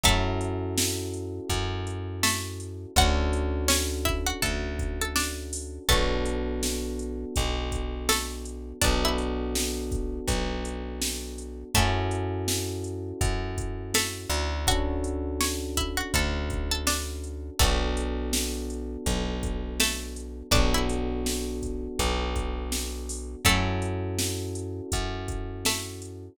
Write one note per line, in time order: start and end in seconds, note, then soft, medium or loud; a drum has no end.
0.04 1.40 F#2 medium
0.04 2.07 A3 medium
0.04 2.92 C#4 medium
0.04 2.92 E4 medium
0.04 2.92 F#4 medium
0.04 2.92 A4 medium
0.04 2.07 A4 medium
0.04 kick medium
0.04 closed hi-hat medium
0.41 closed hi-hat medium
0.78 snare loud
1.14 closed hi-hat medium
1.50 2.86 F#2 medium
1.50 kick medium
1.50 closed hi-hat medium
1.87 closed hi-hat medium
2.23 2.91 A3 medium
2.23 2.91 A4 medium
2.23 snare loud
2.60 closed hi-hat medium
2.96 4.33 D2 medium
2.96 5.85 C#4 medium
2.96 5.85 D4 medium
2.96 5.85 F#4 medium
2.96 3.65 F#4 medium
2.96 5.85 A4 medium
2.96 3.65 F#5 medium
2.96 kick medium
2.96 closed hi-hat medium
3.33 closed hi-hat medium
3.68 4.03 C#4 medium
3.68 4.03 C#5 medium
3.68 snare loud
4.05 4.25 E4 medium
4.05 4.25 E5 medium
4.05 kick medium
4.05 closed hi-hat medium
4.26 4.41 F#4 medium
4.26 4.41 F#5 medium
4.42 5.79 D2 medium
4.42 4.75 A4 medium
4.42 4.75 A5 medium
4.42 kick medium
4.42 closed hi-hat medium
4.79 kick medium
4.79 closed hi-hat medium
5.01 5.16 A4 medium
5.01 5.16 A5 medium
5.16 5.81 D4 medium
5.16 5.81 D5 medium
5.16 snare medium
5.53 open hi-hat medium
5.89 7.25 B1 medium
5.89 8.00 A3 medium
5.89 8.77 B3 medium
5.89 8.77 D4 medium
5.89 8.77 F#4 medium
5.89 8.00 A4 medium
5.89 8.77 A4 medium
5.89 kick medium
5.89 closed hi-hat medium
6.25 closed hi-hat medium
6.63 snare medium
6.99 closed hi-hat medium
7.36 8.73 B1 medium
7.36 kick medium
7.36 closed hi-hat medium
7.72 kick medium
7.72 closed hi-hat medium
8.09 8.45 A3 medium
8.09 8.45 A4 medium
8.09 snare medium
8.45 closed hi-hat medium
8.81 10.20 B1 medium
8.81 11.69 B3 medium
8.81 9.02 D4 medium
8.81 11.69 D4 medium
8.81 11.69 F#4 medium
8.81 11.69 A4 medium
8.81 9.02 D5 medium
8.81 kick medium
8.81 closed hi-hat medium
9.05 9.85 E4 medium
9.05 9.85 E5 medium
9.18 closed hi-hat medium
9.55 snare medium
9.92 kick medium
9.92 closed hi-hat medium
10.27 11.64 B1 medium
10.27 kick medium
10.27 closed hi-hat medium
10.65 closed hi-hat medium
11.02 snare medium
11.38 closed hi-hat medium
11.74 13.13 F#2 medium
11.74 13.77 A3 medium
11.74 14.63 C#4 medium
11.74 14.63 E4 medium
11.74 14.63 F#4 medium
11.74 13.77 A4 medium
11.74 14.63 A4 medium
11.74 kick medium
11.74 closed hi-hat medium
12.11 closed hi-hat medium
12.48 snare medium
12.84 closed hi-hat medium
13.21 14.26 F#2 medium
13.21 kick medium
13.21 closed hi-hat medium
13.58 kick medium
13.58 closed hi-hat medium
13.94 14.63 A3 medium
13.94 14.63 A4 medium
13.94 snare medium
14.29 16.03 D2 medium
14.29 closed hi-hat medium
14.67 17.55 C#4 medium
14.67 17.55 D4 medium
14.67 17.55 F#4 medium
14.67 15.35 F#4 medium
14.67 17.55 A4 medium
14.67 15.35 F#5 medium
14.67 kick medium
14.67 closed hi-hat medium
15.04 closed hi-hat medium
15.41 15.76 C#5 medium
15.41 15.76 C#6 medium
15.41 snare medium
15.77 15.97 E4 medium
15.77 15.97 E5 medium
15.77 kick medium
15.77 closed hi-hat medium
15.97 16.12 F#4 medium
15.97 16.12 F#5 medium
16.14 17.50 D2 medium
16.14 16.48 A4 medium
16.14 16.48 A5 medium
16.14 kick medium
16.14 closed hi-hat medium
16.50 kick medium
16.50 closed hi-hat medium
16.71 16.86 A4 medium
16.71 16.86 A5 medium
16.87 17.52 D4 medium
16.87 17.52 D5 medium
16.87 snare medium
17.24 closed hi-hat medium
17.59 18.97 B1 medium
17.59 19.71 A3 medium
17.59 20.47 B3 medium
17.59 20.47 D4 medium
17.59 20.47 F#4 medium
17.59 19.71 A4 medium
17.59 20.47 A4 medium
17.59 kick medium
17.59 closed hi-hat medium
17.97 closed hi-hat medium
18.33 snare medium
18.70 closed hi-hat medium
19.06 20.43 B1 medium
19.06 kick medium
19.06 closed hi-hat medium
19.43 kick medium
19.43 closed hi-hat medium
19.80 20.48 A3 medium
19.80 20.48 A4 medium
19.80 snare medium
20.16 closed hi-hat medium
20.51 21.88 B1 medium
20.51 23.40 B3 medium
20.51 20.72 D4 medium
20.51 23.40 D4 medium
20.51 23.40 F#4 medium
20.51 23.40 A4 medium
20.51 20.72 D5 medium
20.51 kick loud
20.51 closed hi-hat medium
20.74 21.55 E4 medium
20.74 21.55 E5 medium
20.89 closed hi-hat medium
21.26 snare medium
21.62 kick medium
21.62 closed hi-hat medium
21.99 23.36 B1 medium
21.99 kick medium
21.99 closed hi-hat medium
22.36 kick medium
22.36 closed hi-hat medium
22.72 snare medium
23.09 open hi-hat medium
23.45 24.81 F#2 medium
23.45 25.54 A3 medium
23.45 26.33 C#4 medium
23.45 26.33 E4 medium
23.45 26.33 F#4 medium
23.45 26.33 A4 medium
23.45 25.54 A4 medium
23.45 kick medium
23.45 closed hi-hat loud
23.82 closed hi-hat medium
24.19 snare medium
24.55 closed hi-hat medium
24.92 26.29 F#2 medium
24.92 kick medium
24.92 closed hi-hat medium
25.28 kick medium
25.28 closed hi-hat medium
25.65 26.31 A3 medium
25.65 26.31 A4 medium
25.65 snare medium
26.02 closed hi-hat medium